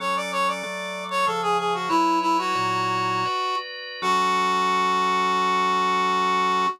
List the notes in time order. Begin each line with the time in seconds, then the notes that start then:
0.00 F#3 C#4 A4 C#5
0.16 D5
0.32 C#5
0.48 D5
0.63 F#3 A3 A4
1.11 C#5
1.26 C#3 F3 G#4 A4
1.42 G#4
1.58 G#4
1.74 F#4
1.89 F#3 E4 B4 C#5
2.22 E4
2.38 F#4
2.55 A#2 F#3 E4 C#5
3.25 F#4 B4 D5
4.02 F#3 C#4 F#4 A4